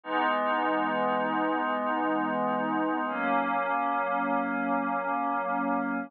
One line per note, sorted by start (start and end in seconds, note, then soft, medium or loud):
0.03 3.04 E3 medium
0.03 3.04 G#3 medium
0.03 3.04 B3 medium
0.03 3.04 D#4 medium
3.07 6.08 F#3 medium
3.07 6.08 A#3 medium
3.07 6.08 C#4 medium